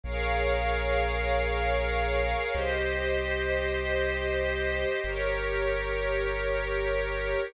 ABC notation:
X:1
M:3/4
L:1/8
Q:1/4=72
K:Ab
V:1 name="Pad 5 (bowed)"
[ABdf]6 | [Gce]6 | [GBd]6 |]
V:2 name="Synth Bass 2" clef=bass
B,,,6 | C,,6 | G,,,6 |]